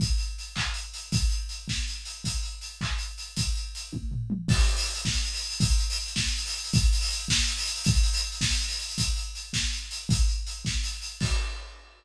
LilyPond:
\new DrumStaff \drummode { \time 6/8 \tempo 4. = 107 <hh bd>8 hh8 hh8 <hc bd>8 hh8 hh8 | <hh bd>8 hh8 hh8 <bd sn>8 hh8 hh8 | <hh bd>8 hh8 hh8 <hc bd>8 hh8 hh8 | <hh bd>8 hh8 hh8 <bd tommh>8 tomfh8 toml8 |
<cymc bd>16 hh16 hh16 hho16 hh16 hh16 <bd sn>16 hh16 hh16 hho16 hh16 hh16 | <hh bd>16 hh16 hh16 hho16 hh16 hh16 <bd sn>16 hh16 hh16 hho16 hh16 hh16 | <hh bd>16 hh16 hh16 hho16 hh16 hh16 <bd sn>16 hh16 hh16 hho16 hh16 hh16 | <hh bd>16 hh16 hh16 hho16 hh16 hh16 <bd sn>16 hh16 hh16 hho16 hh16 hh16 |
<hh bd>8 hh8 hh8 <bd sn>8 hh8 hh8 | <hh bd>8 hh8 hh8 <bd sn>8 hh8 hh8 | <cymc bd>4. r4. | }